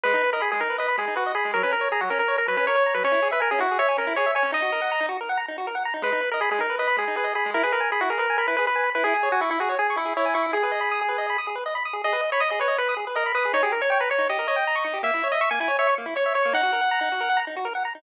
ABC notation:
X:1
M:4/4
L:1/16
Q:1/4=160
K:G#m
V:1 name="Lead 1 (square)"
B3 A G G A2 B2 G2 F2 G2 | A B A2 G F A A2 A B B c3 B | c3 B A G F2 c2 A2 c2 c2 | d6 z10 |
B3 A G G A2 B2 G2 G2 G2 | A B A2 G F A A2 A B B B3 B | G3 F E E F2 G2 E2 E2 E2 | G10 z6 |
d3 c d d c2 B2 z2 A2 B2 | c G A c c B c2 d2 d6 | e3 d e g g2 c2 z2 c2 c2 | f10 z6 |]
V:2 name="Lead 1 (square)"
G, D B d b G, D B d b G, D B d b G, | F, C A c a F, C A c a F, C A c a F, | C E G e g C E G e g C E G e g C | D F A f a D F A f a D F A f a D |
G, D B d b G, D B d b G, D B d b G, | E G B g b E G B g b E G B g b E | E G c g c' E G c g c' E G c g c' E | G B d b d' G B d b d' G B d b d' G |
G B d b d' G B d b d' G B d b d' G | D =G A c =g a c' D G A c g a c' D G | A, E c e c' A, E c e c' A, E c e c' A, | D F A f a D F A f a D F A f a D |]